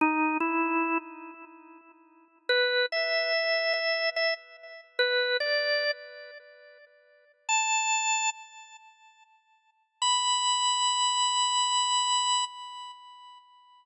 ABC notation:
X:1
M:4/4
L:1/8
Q:"Swing" 1/4=96
K:B
V:1 name="Drawbar Organ"
D E2 z5 | B e3 e e z2 | B =d2 z5 | =a3 z5 |
b8 |]